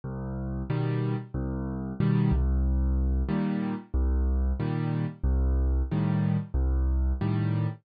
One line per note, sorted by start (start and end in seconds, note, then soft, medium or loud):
0.04 0.63 C2 loud
0.70 1.15 B2 medium
0.70 1.15 D#3 medium
0.70 1.15 G3 medium
1.34 1.93 C2 loud
2.00 2.31 B2 medium
2.00 2.31 D#3 medium
2.00 2.31 G3 medium
2.32 3.23 C2 loud
3.29 3.74 A#2 loud
3.29 3.74 D#3 medium
3.29 3.74 G3 medium
3.94 4.53 C2 loud
4.60 5.05 A#2 medium
4.60 5.05 D#3 medium
4.60 5.05 G3 medium
5.24 5.82 C2 loud
5.91 6.37 A2 medium
5.91 6.37 D#3 medium
5.91 6.37 G3 medium
6.54 7.13 C2 loud
7.21 7.67 A2 medium
7.21 7.67 D#3 medium
7.21 7.67 G3 medium